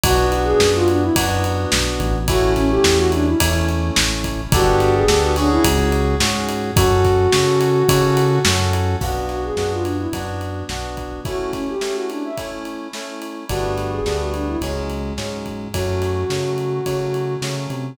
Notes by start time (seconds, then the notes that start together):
0.04 B1 B3 D4 F#4, kick, ride
0.32 F#4, snare, ride
0.44 G#4
0.59 F#2, snare
0.75 F4
0.88 D4, ride
1.03 E4
1.16 F#2 B3 D4 F#4, kick, ride
1.44 ride
1.72 B1, snare
2.00 A1, kick, ride
2.28 A3 C#4 E4 F#4, kick, ride
2.56 C#4, kick, snare, ride
2.70 G4
2.84 E2, snare
2.97 F#4
3.12 D4, ride
3.25 E4
3.40 E2 A3 C#4 E4, kick, ride
3.69 ride
3.96 A1, snare
4.24 kick, ride
4.52 G1 B3 D4 F#4 G4 A4, kick, ride
4.80 F#4, snare, ride
4.94 G#4
5.08 D2 B3 D4 G4 A4, snare
5.22 F#4
5.36 C#4 D4 F#4 G#4, ride
5.51 E4
5.64 C#2, kick, ride
5.92 ride
6.20 G#2 C#4 F#4 G#4, snare
6.49 ride
6.76 F#2 C#4 F#4 A4, kick, ride
7.05 kick, snare, ride
7.32 C#3 C#4 F#4 A4, snare
7.61 ride
7.89 C#3 C#4 F#4 A4, kick, ride
8.17 ride
8.45 F#2 C#4 F#4 A4, snare
8.73 ride
9.00 B1 B3 D4 F#4, kick, crash
9.29 F#4, snare, ride
9.43 G#4
9.57 F#2 B3 D4 F#4, snare
9.72 F4
9.84 D4, ride
9.99 E4
10.13 F#2 B3 D4 F#4, kick, ride
10.41 ride
10.69 B1 B3 D4 F#4, snare
10.97 kick, ride
11.25 A3 C#4 E4 F#4, kick, ride
11.53 C#4, kick, snare, ride
11.69 G4
11.81 A3 C#4 E4, snare
11.95 F#4
12.10 D4, ride
12.25 E5
12.37 A3 C#4 E4, kick, ride
12.65 ride
12.93 A3 C#4 E4, snare
13.22 ride
13.49 G1 G3 A3 B3 D4 F#4, kick, ride
13.77 F#4, snare, ride
13.91 G#4
14.06 D2 G3 A3 B3 D4, snare
14.20 F#4
14.33 D4, ride
14.48 E4
14.61 C#2 F#3 G#3 C#4, kick, ride
14.90 ride
15.17 G#2 F#3 G#3 C#4, snare
15.46 kick, ride
15.72 F#2 F#3 A3 C#4 F#4, kick, ride
16.02 snare, ride
16.30 C#3 F#3 A3 C#4, snare
16.58 ride
16.86 C#3 F#3 A3 C#4, kick, ride
17.14 ride
17.42 C#3 F#3 A3 C#4, snare
17.70 C3, ride